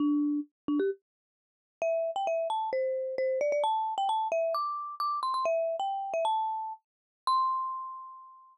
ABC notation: X:1
M:4/4
L:1/16
Q:1/4=132
K:C
V:1 name="Marimba"
D4 z2 D G z8 | e3 g e2 a2 c4 c2 d d | a3 g a2 e2 d'4 d'2 c' c' | e3 g3 e a5 z4 |
c'16 |]